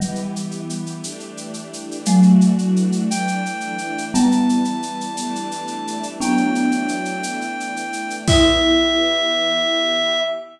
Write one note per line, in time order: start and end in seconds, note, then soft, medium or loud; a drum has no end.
0.00 1.02 E3 loud
0.00 1.85 E3 medium
0.00 1.85 G3 medium
0.00 1.02 B3 medium
0.00 1.02 G4 loud
0.00 shaker medium
0.15 shaker medium
0.36 shaker medium
0.51 shaker medium
0.70 shaker medium
0.86 shaker medium
1.03 2.06 E3 medium
1.03 2.06 A3 medium
1.03 2.06 D4 loud
1.03 2.06 G4 loud
1.03 shaker loud
1.20 shaker medium
1.37 shaker medium
1.54 shaker medium
1.73 shaker medium
1.91 shaker medium
2.05 3.09 E3 medium
2.05 3.74 F#3 medium
2.05 3.74 A3 medium
2.05 3.09 A3 loud
2.05 3.09 D4 loud
2.05 3.09 F#4 loud
2.05 shaker loud
2.23 shaker medium
2.41 shaker medium
2.58 shaker medium
2.76 shaker medium
2.92 shaker medium
3.10 4.13 E3 loud
3.10 4.13 A3 loud
3.10 4.13 D4 loud
3.10 4.05 G5 medium
3.10 shaker loud
3.28 shaker medium
3.46 shaker medium
3.60 shaker medium
3.78 shaker medium
3.98 shaker medium
4.14 5.16 E3 loud
4.14 5.16 G3 loud
4.14 5.80 G3 medium
4.14 5.16 B3 medium
4.14 5.80 B3 medium
4.14 6.07 A5 medium
4.14 shaker loud
4.32 shaker medium
4.49 shaker medium
4.65 shaker medium
4.82 shaker medium
5.01 shaker medium
5.17 6.20 E3 loud
5.17 6.20 G3 loud
5.17 6.20 A3 loud
5.17 6.20 D4 loud
5.17 shaker loud
5.35 shaker medium
5.51 shaker medium
5.67 shaker medium
5.87 shaker medium
6.03 shaker medium
6.20 7.23 E3 medium
6.20 7.23 F#3 loud
6.20 7.23 A3 loud
6.20 7.88 B3 medium
6.20 7.88 D4 medium
6.20 7.23 D4 loud
6.20 8.16 G5 medium
6.20 shaker loud
6.37 shaker medium
6.55 shaker medium
6.72 shaker medium
6.88 shaker medium
7.05 shaker medium
7.23 8.27 E3 loud
7.23 8.27 A3 medium
7.23 8.27 D4 medium
7.23 shaker loud
7.41 shaker medium
7.60 shaker medium
7.76 shaker medium
7.93 shaker medium
8.10 shaker medium
8.28 10.20 E3 medium
8.28 10.20 B3 loud
8.28 10.21 E4 loud
8.28 10.20 G4 loud
8.28 10.20 E5 loud
8.28 kick loud
8.28 crash loud